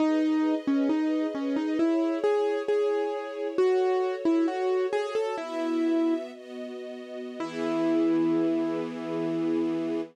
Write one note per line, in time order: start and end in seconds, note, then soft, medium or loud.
0.00 0.55 D#4 loud
0.00 1.78 G#4 medium
0.00 1.78 B4 medium
0.00 1.78 D#5 medium
0.67 0.89 C#4 medium
0.89 1.27 D#4 medium
1.35 1.56 C#4 medium
1.56 1.78 D#4 medium
1.79 2.19 E4 medium
1.79 3.56 E4 medium
1.79 3.56 G#4 medium
1.79 3.56 C#5 medium
2.24 2.62 G#4 medium
2.68 3.47 G#4 medium
3.57 5.35 F#4 medium
3.57 4.15 F#4 loud
3.57 5.35 A4 medium
3.57 5.35 C#5 medium
4.25 4.46 E4 medium
4.48 4.87 F#4 medium
4.93 5.14 G#4 loud
5.15 5.36 A4 medium
5.37 6.31 B3 medium
5.37 6.14 E4 medium
5.37 6.31 F#4 medium
5.37 6.31 E5 medium
6.33 7.39 B3 medium
6.33 7.39 F#4 medium
6.33 7.39 D#5 medium
7.39 10.01 E3 loud
7.39 10.01 B3 loud
7.39 10.02 E4 loud
7.39 10.01 G#4 medium